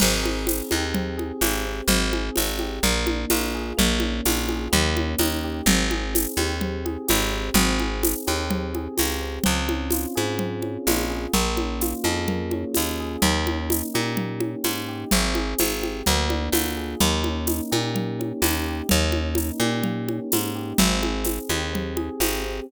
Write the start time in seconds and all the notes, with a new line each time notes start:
0.00 G#1 C4, crash, low conga
0.23 G#4, high conga
0.47 C4, tambourine, high conga
0.71 D#2 G4, high conga
0.94 C4, low conga
1.17 G#4, high conga
1.41 G#1 G4, tambourine, high conga
1.66 C4
1.88 G#1 C4, low conga
2.13 G#4, high conga
2.36 G#1 C4, tambourine, high conga
2.59 G4, high conga
2.83 A#1 A#3, low conga
3.07 D4, high conga
3.30 A#1 F4, tambourine, high conga
3.54 G#4
3.77 A#1 A#3, low conga
4.00 C#4, high conga
4.25 A#1 F4, tambourine, high conga
4.49 G#4, high conga
4.72 D#2 A#3, low conga
4.96 C#4, high conga
5.19 D#2 D#4, tambourine, high conga
5.44 G4
5.66 G#1 C4, low conga
5.91 G#4, high conga
6.14 C4, tambourine, high conga
6.37 D#2 G4, high conga
6.61 C4, low conga
6.85 G#4, high conga
7.08 G#1 G4, tambourine, high conga
7.32 C4
7.54 G#1 C4, low conga
7.79 G#4, high conga
8.03 C4, tambourine, high conga
8.27 D#2 G4, high conga
8.50 C4, low conga
8.75 G#4, high conga
8.97 C#2 G4, tambourine, high conga
9.22 C4
9.44 C#2 C4, low conga
9.68 C#4, high conga
9.91 F4, tambourine, high conga
10.15 G#2 G#4, high conga
10.39 C4, low conga
10.62 C#4, high conga
10.87 A#1 F4, tambourine, high conga
11.10 G#4
11.33 A#1 A#3, low conga
11.57 C#4, high conga
11.81 F4, tambourine, high conga
12.04 F2 G#4, high conga
12.28 A#3, low conga
12.51 C#4, high conga
12.75 D#2 F4, tambourine, high conga
13.00 G#4
13.22 D#2 A#3, low conga
13.46 C#4, high conga
13.70 D#4, tambourine, high conga
13.94 A#2 G4, high conga
14.17 A#3, low conga
14.40 C#4, high conga
14.64 G#2 D#4, tambourine, high conga
14.88 G4
15.11 G#1 C4, low conga
15.35 G#4, high conga
15.58 G#1 C4, tambourine, high conga
15.82 G4, high conga
16.06 D2 A#3, low conga
16.30 D4, high conga
16.52 D2 F4, tambourine, high conga
16.77 G#4
17.00 D#2 A#3, low conga
17.24 C#4, high conga
17.47 D#4, tambourine, high conga
17.71 A#2 G4, high conga
17.94 A#3, low conga
18.19 C#4, high conga
18.42 D#2 D#4, tambourine, high conga
18.66 G4
18.89 D#2 A#3, low conga
19.12 C#4, high conga
19.35 D#4, tambourine, high conga
19.60 A#2 G4, high conga
19.83 A#3, low conga
20.08 C#4, high conga
20.32 G#2 D#4, tambourine, high conga
20.55 G4
20.78 G#1 C4, low conga
21.02 G#4, high conga
21.25 C4, tambourine, high conga
21.49 D#2 G4, high conga
21.73 C4, low conga
21.97 G#4, high conga
22.20 G#1 G4, tambourine, high conga
22.44 C4